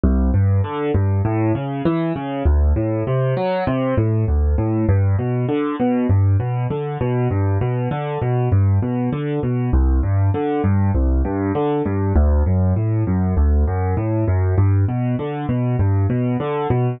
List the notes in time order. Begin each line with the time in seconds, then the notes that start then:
0.04 C2
0.34 G2
0.64 D3
0.94 G2
1.25 A2
1.55 C#3
1.85 E3
2.16 C#3
2.45 D2
2.76 A2
3.07 C3
3.37 F#3
3.67 C3
3.97 A2
4.28 D2
4.58 A2
4.89 G2
5.19 B2
5.48 D3
5.80 B2
6.09 G2
6.40 B2
6.70 D3
7.01 B2
7.31 G2
7.61 B2
7.91 D3
8.22 B2
8.52 G2
8.82 B2
9.13 D3
9.43 B2
9.73 C2
10.03 G2
10.34 D3
10.64 G2
10.95 C2
11.25 G2
11.55 D3
11.85 G2
12.16 D2
12.46 F#2
12.76 A2
13.07 F#2
13.37 D2
13.67 F#2
13.97 A2
14.28 F#2
14.58 G2
14.89 B2
15.19 D3
15.49 B2
15.79 G2
16.10 B2
16.40 D3
16.70 B2